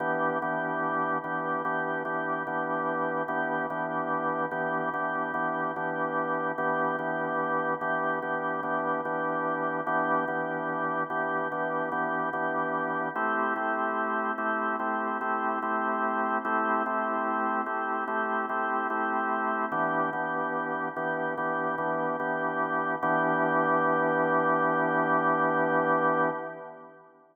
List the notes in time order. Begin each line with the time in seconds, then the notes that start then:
0.00 E3 B3 D4 G4
0.42 E3 B3 D4 G4
1.24 E3 B3 D4 G4
1.65 E3 B3 D4 G4
2.05 E3 B3 D4 G4
2.47 E3 B3 D4 G4
3.28 E3 B3 D4 G4
3.70 E3 B3 D4 G4
4.51 E3 B3 D4 G4
4.94 E3 B3 D4 G4
5.34 E3 B3 D4 G4
5.76 E3 B3 D4 G4
6.58 E3 B3 D4 G4
6.99 E3 B3 D4 G4
7.81 E3 B3 D4 G4
8.22 E3 B3 D4 G4
8.63 E3 B3 D4 G4
9.05 E3 B3 D4 G4
9.87 E3 B3 D4 G4
10.28 E3 B3 D4 G4
11.10 E3 B3 D4 G4
11.52 E3 B3 D4 G4
11.92 E3 B3 D4 G4
12.33 E3 B3 D4 G4
13.16 A3 C4 E4 G4
13.56 A3 C4 E4 G4
14.38 A3 C4 E4 G4
14.79 A3 C4 E4 G4
15.21 A3 C4 E4 G4
15.63 A3 C4 E4 G4
16.45 A3 C4 E4 G4
16.86 A3 C4 E4 G4
17.66 A3 C4 E4 G4
18.08 A3 C4 E4 G4
18.49 A3 C4 E4 G4
18.90 A3 C4 E4 G4
19.72 E3 B3 D4 G4
20.13 E3 B3 D4 G4
20.96 E3 B3 D4 G4
21.38 E3 B3 D4 G4
21.78 E3 B3 D4 G4
22.20 E3 B3 D4 G4
23.03 E3 B3 D4 G4